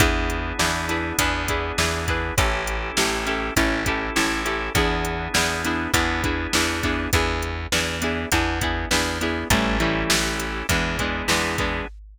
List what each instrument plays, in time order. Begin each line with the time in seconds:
0.00 electric bass (finger) E2, drawbar organ B3 D4 E4 G#4, acoustic guitar (steel) D4 E4 G#4 B4, kick, closed hi-hat
0.30 closed hi-hat
0.59 electric bass (finger) E2, acoustic guitar (steel) D4 E4 G#4 B4, snare
0.89 acoustic guitar (steel) D4 E4 G#4 B4, closed hi-hat
1.18 electric bass (finger) E2, drawbar organ B3 D4 E4 G#4, acoustic guitar (steel) D4 E4 G#4 B4, kick, closed hi-hat
1.48 acoustic guitar (steel) D4 E4 G#4 B4, kick, closed hi-hat
1.78 electric bass (finger) E2, acoustic guitar (steel) D4 E4 G#4 B4, snare
2.08 acoustic guitar (steel) D4 E4 G#4 B4, kick, closed hi-hat
2.37 electric bass (finger) A1, acoustic guitar (steel) C#4 E4 G4 A4, drawbar organ C#4 E4 G4 A4, kick, closed hi-hat
2.67 closed hi-hat
2.97 electric bass (finger) A1, acoustic guitar (steel) C#4 E4 G4 A4, snare
3.26 acoustic guitar (steel) C#4 E4 G4 A4, closed hi-hat
3.56 electric bass (finger) A1, drawbar organ C#4 E4 G4 A4, acoustic guitar (steel) C#4 E4 G4 A4, kick, closed hi-hat
3.86 acoustic guitar (steel) C#4 E4 G4 A4, kick, closed hi-hat
4.16 electric bass (finger) A1, acoustic guitar (steel) C#4 E4 G4 A4, snare
4.45 acoustic guitar (steel) C#4 E4 G4 A4, closed hi-hat
4.74 electric bass (finger) E2, drawbar organ B3 D4 E4 G#4, acoustic guitar (steel) B3 D4 E4 G#4, kick, closed hi-hat
5.05 closed hi-hat
5.34 electric bass (finger) E2, acoustic guitar (steel) B3 D4 E4 G#4, snare
5.65 acoustic guitar (steel) B3 D4 E4 G#4, closed hi-hat
5.94 electric bass (finger) E2, drawbar organ B3 D4 E4 G#4, acoustic guitar (steel) B3 D4 E4 G#4, kick, closed hi-hat
6.24 acoustic guitar (steel) B3 D4 E4 G#4, kick, closed hi-hat
6.53 electric bass (finger) E2, acoustic guitar (steel) B3 D4 E4 G#4, snare
6.83 acoustic guitar (steel) B3 D4 E4 G#4, kick, closed hi-hat
7.13 electric bass (finger) E2, acoustic guitar (steel) B3 D4 E4 G#4, kick, closed hi-hat
7.42 closed hi-hat
7.72 electric bass (finger) E2, acoustic guitar (steel) B3 D4 E4 G#4, snare
8.02 acoustic guitar (steel) B3 D4 E4 G#4, closed hi-hat
8.32 electric bass (finger) E2, acoustic guitar (steel) B3 D4 E4 G#4, kick, closed hi-hat
8.61 acoustic guitar (steel) B3 D4 E4 G#4, kick, closed hi-hat
8.91 electric bass (finger) E2, acoustic guitar (steel) B3 D4 E4 G#4, snare
9.21 acoustic guitar (steel) B3 D4 E4 G#4, closed hi-hat
9.50 electric bass (finger) A1, acoustic guitar (steel) E3 G3 A3 C#4, drawbar organ C#4 E4 G4 A4, kick, closed hi-hat
9.80 acoustic guitar (steel) E3 G3 A3 C#4, closed hi-hat
10.10 electric bass (finger) A1, snare
10.40 closed hi-hat
10.69 electric bass (finger) E2, acoustic guitar (steel) E3 G#3 B3 D4, drawbar organ B3 D4 E4 G#4, kick, closed hi-hat
10.99 acoustic guitar (steel) E3 G#3 B3 D4, kick, closed hi-hat
11.28 electric bass (finger) E2, acoustic guitar (steel) E3 G#3 B3 D4, snare
11.58 acoustic guitar (steel) E3 G#3 B3 D4, kick, closed hi-hat